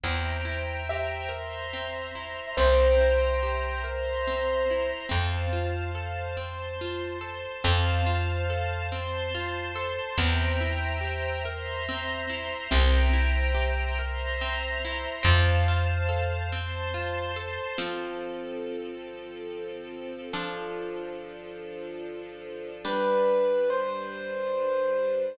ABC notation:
X:1
M:3/4
L:1/8
Q:1/4=71
K:F
V:1 name="Acoustic Grand Piano"
z2 e4 | c6 | z6 | z6 |
z6 | z6 | z6 | z6 |
z6 | =B2 c4 |]
V:2 name="Orchestral Harp"
C E G B C E | C E G B C E | C F A C F A | C F A C F A |
C E G B C E | C E G B C E | C F A C F A | [F,CA]6 |
[F,DA]6 | [G,D=B]6 |]
V:3 name="Electric Bass (finger)" clef=bass
E,,6 | C,,6 | F,,6 | F,,6 |
E,,6 | C,,6 | F,,6 | z6 |
z6 | z6 |]
V:4 name="String Ensemble 1"
[cegb]3 [cebc']3 | [cegb]3 [cebc']3 | [cfa]3 [cac']3 | [cfa]3 [cac']3 |
[cegb]3 [cebc']3 | [cegb]3 [cebc']3 | [cfa]3 [cac']3 | [F,CA]6 |
[F,DA]6 | [G,D=B]6 |]